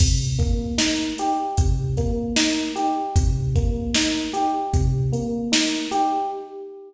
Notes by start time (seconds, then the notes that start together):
0.00 C3, kick, crash
0.38 A#3, kick, closed hi-hat
0.78 D#4, snare
1.18 G4, closed hi-hat
1.57 C3, kick, closed hi-hat
1.97 A#3, kick, closed hi-hat
2.36 D#4, snare
2.75 G4, closed hi-hat
3.16 C3, kick, closed hi-hat
3.55 A#3, kick, closed hi-hat
3.94 D#4, snare
4.33 G4, closed hi-hat
4.73 C3, kick, closed hi-hat
5.13 A#3, closed hi-hat
5.52 D#4, snare
5.91 G4, closed hi-hat